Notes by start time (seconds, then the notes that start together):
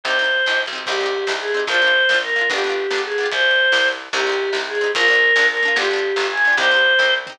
0.04 C2 C4 C5, kick, ride
0.08 D#4 G4
0.19 C4 D#4
0.24 G4, ride
0.46 A#1 C4 D#4, snare
0.51 G4
0.66 B1, ride
0.73 C4 D#4
0.78 G4
0.86 C2 C4 D#4 G4, kick, crash
0.92 G4
1.01 C4 D#4
1.06 G4, ride
1.27 C2 C4 D#4, snare
1.32 G4
1.40 G#4
1.48 ride
1.54 C4 D#4
1.59 G4
1.67 A#1 A#3 C5, kick, ride
1.71 D4 F4
1.82 A#3 D4
1.87 F4, ride
2.09 A#1 A#3 D4, snare
2.14 F4
2.23 A#4
2.29 ride
2.36 A#3 D4
2.41 F4
2.50 G1 B3 D4 G4, kick, ride
2.56 F4 G4
2.64 B3 D4
2.69 F4 G4, ride
2.90 G1 B3 D4, snare
2.96 F4 G4
3.04 G#4
3.12 ride
3.18 B3 D4
3.23 F4 G4
3.32 C2 C5, kick, ride
3.51 ride
3.72 C2, snare
3.93 ride
4.13 C2 C4 D#4 G4, kick, crash
4.19 G4
4.27 C4 D#4
4.32 G4, ride
4.53 C2 C4, snare
4.57 D#4 G4
4.68 G#4
4.75 ride
4.81 C4 D#4
4.86 G4
4.95 A#1 A#3 D4 A#4, kick, ride
5.01 F4
5.08 A#3 D4
5.13 F4, ride
5.36 A#1 A#3 D4, snare
5.41 F4
5.50 A#4
5.57 ride
5.63 A#3 D4
5.68 F4
5.76 G1 B3 D4 G4, kick, ride
5.82 F4 G4
5.91 B3 D4
5.96 F4 G4, ride
6.16 G1 B3, snare
6.20 D4 F4
6.25 G4
6.31 G#5
6.37 ride
6.45 B3 D4
6.50 F4 G4
6.57 C2 C4 D#4 C5, kick, ride
6.63 G4
6.71 C4 D#4
6.76 G4, ride
6.99 C2 C4 D#4, kick, snare
7.05 G4
7.27 C4 D#4, floor tom
7.32 G4